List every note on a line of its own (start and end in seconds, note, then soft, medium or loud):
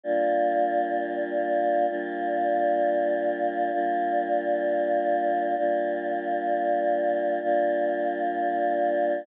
0.03 1.86 G3 medium
0.03 1.86 A#3 medium
0.03 1.86 D4 medium
0.03 1.86 F4 loud
1.88 3.71 G3 loud
1.88 3.71 A#3 medium
1.88 3.71 D4 medium
1.88 3.71 F4 loud
3.72 5.55 G3 loud
3.72 5.55 A#3 medium
3.72 5.55 D4 medium
3.72 5.55 F4 loud
5.56 7.39 G3 loud
5.56 7.39 A#3 medium
5.56 7.39 D4 medium
5.56 7.39 F4 medium
7.42 9.24 G3 medium
7.42 9.24 A#3 medium
7.42 9.24 D4 medium
7.42 9.24 F4 loud